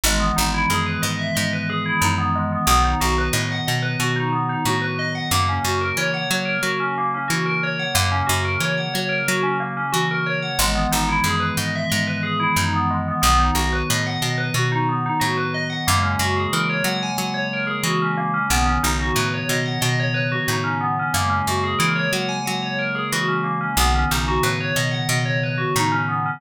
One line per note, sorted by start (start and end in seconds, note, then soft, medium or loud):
0.03 0.32 G#1 loud
0.03 2.65 D#3 medium
0.03 2.65 E3 medium
0.03 2.65 G#3 medium
0.03 0.21 G#3 loud
0.03 2.65 B3 medium
0.20 0.35 B3 medium
0.36 0.66 G#1 medium
0.36 0.51 D#4 medium
0.54 0.69 E4 medium
0.70 0.98 F#2 medium
0.70 0.85 G#4 medium
0.86 1.01 B4 medium
1.02 1.31 G#2 medium
1.02 1.17 D#5 medium
1.19 1.34 E5 medium
1.35 1.93 G#2 medium
1.35 1.50 D#5 medium
1.53 1.68 B4 medium
1.70 1.84 G#4 medium
1.86 2.01 E4 medium
2.01 2.58 F#2 medium
2.01 2.16 D#4 medium
2.18 2.33 B3 medium
2.35 2.50 G#3 medium
2.52 2.67 B3 medium
2.67 2.95 B1 loud
2.67 5.28 D#3 medium
2.67 5.28 F#3 medium
2.67 5.28 B3 medium
2.67 2.83 B3 loud
2.84 2.99 D#4 medium
3.01 3.29 B1 medium
3.01 3.15 F#4 medium
3.18 3.33 B4 medium
3.33 3.61 A2 medium
3.33 3.48 D#5 medium
3.52 3.66 F#5 medium
3.67 3.96 B2 medium
3.67 3.82 D#5 medium
3.82 3.97 B4 medium
4.00 4.56 B2 medium
4.00 4.15 F#4 medium
4.16 4.31 D#4 medium
4.32 4.47 B3 medium
4.49 4.64 D#4 medium
4.65 5.21 A2 medium
4.65 4.81 F#4 medium
4.82 4.96 B4 medium
4.99 5.14 D#5 medium
5.15 5.30 F#5 medium
5.31 5.59 F#2 medium
5.31 7.93 C#3 medium
5.31 7.93 F#3 medium
5.31 5.46 A#3 loud
5.31 7.93 A#3 medium
5.49 5.64 C#4 medium
5.64 5.92 F#2 medium
5.64 5.80 F#4 medium
5.81 5.96 A#4 medium
5.97 6.25 E3 medium
5.97 6.13 C#5 loud
6.14 6.29 F#5 medium
6.30 6.59 F#3 medium
6.30 6.45 C#5 medium
6.45 6.60 A#4 medium
6.63 7.19 F#3 medium
6.63 6.79 F#4 medium
6.80 6.95 C#4 medium
6.98 7.13 A#3 medium
7.14 7.29 C#4 medium
7.28 7.86 E3 medium
7.28 7.43 F#4 medium
7.46 7.60 A#4 medium
7.63 7.78 C#5 medium
7.79 7.94 F#5 medium
7.95 8.23 F#2 loud
7.95 10.57 C#3 medium
7.95 10.57 F#3 medium
7.95 8.09 A#3 loud
7.95 10.57 A#3 medium
8.12 8.26 C#4 medium
8.27 8.57 F#2 medium
8.27 8.41 F#4 medium
8.45 8.60 A#4 medium
8.60 8.88 E3 medium
8.60 8.75 C#5 medium
8.77 8.92 F#5 medium
8.94 9.23 F#3 medium
8.94 9.09 C#5 medium
9.09 9.24 A#4 medium
9.28 9.84 F#3 medium
9.28 9.43 F#4 medium
9.43 9.58 C#4 medium
9.60 9.75 A#3 medium
9.77 9.92 C#4 medium
9.92 10.50 E3 medium
9.92 10.07 F#4 loud
10.11 10.26 A#4 medium
10.26 10.41 C#5 medium
10.42 10.57 F#5 medium
10.59 10.87 G#1 loud
10.59 13.20 D#3 medium
10.59 13.20 E3 medium
10.59 10.74 G#3 loud
10.59 13.20 G#3 medium
10.59 13.20 B3 medium
10.75 10.90 B3 medium
10.92 11.20 G#1 medium
10.92 11.07 D#4 medium
11.09 11.23 E4 medium
11.24 11.52 F#2 medium
11.24 11.40 G#4 medium
11.40 11.55 B4 medium
11.57 11.85 G#2 medium
11.57 11.73 D#5 medium
11.75 11.90 E5 medium
11.90 12.48 G#2 medium
11.90 12.05 D#5 medium
12.07 12.22 B4 medium
12.23 12.38 G#4 medium
12.40 12.55 E4 medium
12.56 13.13 F#2 medium
12.56 12.72 D#4 medium
12.74 12.88 B3 medium
12.90 13.05 G#3 medium
13.08 13.21 B3 medium
13.22 13.51 B1 loud
13.22 15.84 D#3 medium
13.22 15.84 F#3 medium
13.22 13.37 B3 loud
13.22 15.84 B3 medium
13.39 13.54 D#4 medium
13.55 13.83 B1 medium
13.55 13.70 F#4 medium
13.73 13.88 B4 medium
13.90 14.18 A2 medium
13.90 14.05 D#5 medium
14.06 14.21 F#5 medium
14.22 14.50 B2 medium
14.22 14.37 D#5 medium
14.38 14.53 B4 medium
14.54 15.10 B2 medium
14.54 14.70 F#4 medium
14.72 14.87 D#4 medium
14.89 15.04 B3 medium
15.06 15.21 D#4 medium
15.20 15.77 A2 medium
15.20 15.35 F#4 medium
15.38 15.52 B4 medium
15.54 15.69 D#5 medium
15.70 15.85 F#5 medium
15.86 16.16 F#2 loud
15.86 18.48 C#3 medium
15.86 18.48 F#3 medium
15.86 18.48 G#3 medium
15.86 18.48 A#3 medium
15.86 16.02 A#3 loud
16.03 16.17 C#4 medium
16.19 16.47 F#2 medium
16.19 16.35 F#4 medium
16.37 16.51 G#4 medium
16.53 16.81 E3 medium
16.53 16.68 A#4 medium
16.70 16.84 C#5 medium
16.84 17.12 F#3 medium
16.84 16.99 F#5 loud
17.03 17.17 G#5 medium
17.17 17.74 F#3 medium
17.17 17.31 F#5 medium
17.34 17.49 C#5 medium
17.53 17.68 A#4 medium
17.67 17.82 G#4 medium
17.83 18.39 E3 medium
17.83 17.99 F#4 medium
18.02 18.17 C#4 medium
18.17 18.32 A#3 medium
18.34 18.49 C#4 medium
18.50 18.78 B1 medium
18.50 21.11 C#3 medium
18.50 21.11 D#3 medium
18.50 21.11 F#3 medium
18.50 21.11 B3 medium
18.50 18.66 B3 loud
18.66 18.81 C#4 medium
18.83 19.12 B1 medium
18.83 18.98 D#4 medium
19.00 19.15 F#4 medium
19.15 19.44 A2 medium
19.15 19.30 B4 medium
19.34 19.48 C#5 medium
19.49 19.77 B2 medium
19.49 19.65 D#5 medium
19.66 19.80 F#5 medium
19.81 20.38 B2 medium
19.81 19.96 D#5 loud
20.00 20.14 C#5 loud
20.14 20.29 B4 medium
20.32 20.47 F#4 medium
20.48 21.04 A2 medium
20.48 20.64 D#4 medium
20.64 20.79 C#4 medium
20.81 20.96 B3 medium
20.99 21.14 C#4 medium
21.14 21.42 F#2 medium
21.14 23.75 C#3 medium
21.14 23.75 F#3 medium
21.14 23.75 G#3 medium
21.14 23.75 A#3 medium
21.14 21.29 A#3 loud
21.30 21.44 C#4 medium
21.47 21.75 F#2 medium
21.47 21.63 F#4 medium
21.64 21.78 G#4 medium
21.79 22.08 E3 medium
21.79 21.93 A#4 medium
21.95 22.10 C#5 medium
22.13 22.41 F#3 medium
22.13 22.28 F#5 medium
22.29 22.43 G#5 medium
22.46 23.03 F#3 medium
22.46 22.61 F#5 medium
22.62 22.77 C#5 medium
22.79 22.94 A#4 medium
22.95 23.10 G#4 medium
23.12 23.69 E3 medium
23.12 23.27 F#4 loud
23.28 23.43 C#4 medium
23.44 23.59 A#3 medium
23.61 23.76 C#4 medium
23.77 24.05 B1 loud
23.77 26.39 C#3 medium
23.77 26.39 D#3 medium
23.77 26.39 F#3 medium
23.77 23.93 B3 loud
23.77 26.39 B3 medium
23.95 24.10 C#4 medium
24.11 24.39 B1 medium
24.11 24.26 D#4 medium
24.28 24.43 F#4 medium
24.43 24.71 A2 medium
24.43 24.58 B4 medium
24.60 24.75 C#5 medium
24.76 25.04 B2 medium
24.76 24.91 D#5 medium
24.91 25.06 F#5 medium
25.09 25.65 B2 medium
25.09 25.24 D#5 medium
25.25 25.40 C#5 medium
25.43 25.58 B4 medium
25.58 25.73 F#4 medium
25.76 26.32 A2 medium
25.76 25.91 D#4 loud
25.92 26.07 C#4 medium
26.09 26.23 B3 medium
26.26 26.41 C#4 medium